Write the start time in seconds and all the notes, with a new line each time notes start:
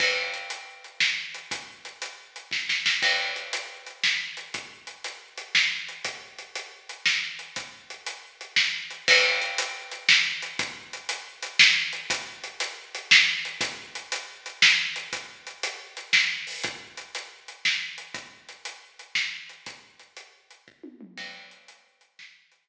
0.00 kick, crash
0.34 closed hi-hat
0.50 closed hi-hat
0.84 closed hi-hat
1.00 snare
1.34 closed hi-hat
1.51 kick, closed hi-hat
1.85 closed hi-hat
2.02 closed hi-hat
2.36 closed hi-hat
2.51 kick, snare
2.69 snare
2.86 snare
3.02 kick, crash
3.36 closed hi-hat
3.53 closed hi-hat
3.86 closed hi-hat
4.04 snare
4.37 closed hi-hat
4.54 kick, closed hi-hat
4.87 closed hi-hat
5.04 closed hi-hat
5.38 closed hi-hat
5.55 snare
5.88 closed hi-hat
6.05 kick, closed hi-hat
6.38 closed hi-hat
6.55 closed hi-hat
6.89 closed hi-hat
7.06 snare
7.39 closed hi-hat
7.56 kick, closed hi-hat
7.90 closed hi-hat
8.06 closed hi-hat
8.41 closed hi-hat
8.56 snare
8.90 closed hi-hat
9.08 kick, crash
9.42 closed hi-hat
9.58 closed hi-hat
9.91 closed hi-hat
10.09 snare
10.42 closed hi-hat
10.59 kick, closed hi-hat
10.93 closed hi-hat
11.09 closed hi-hat
11.42 closed hi-hat
11.59 snare
11.93 closed hi-hat
12.10 kick, closed hi-hat
12.44 closed hi-hat
12.60 closed hi-hat
12.95 closed hi-hat
13.11 snare
13.45 closed hi-hat
13.61 kick, closed hi-hat
13.95 closed hi-hat
14.12 closed hi-hat
14.46 closed hi-hat
14.62 snare
14.96 closed hi-hat
15.13 kick, closed hi-hat
15.47 closed hi-hat
15.63 closed hi-hat
15.97 closed hi-hat
16.13 snare
16.47 open hi-hat
16.63 kick, closed hi-hat
16.97 closed hi-hat
17.15 closed hi-hat
17.48 closed hi-hat
17.65 snare
17.98 closed hi-hat
18.14 kick, closed hi-hat
18.49 closed hi-hat
18.65 closed hi-hat
18.99 closed hi-hat
19.15 snare
19.49 closed hi-hat
19.66 kick, closed hi-hat
19.99 closed hi-hat
20.17 closed hi-hat
20.51 closed hi-hat
20.68 kick
20.84 high tom
21.01 mid tom
21.18 kick, crash
21.51 closed hi-hat
21.68 closed hi-hat
22.01 closed hi-hat
22.19 snare
22.52 closed hi-hat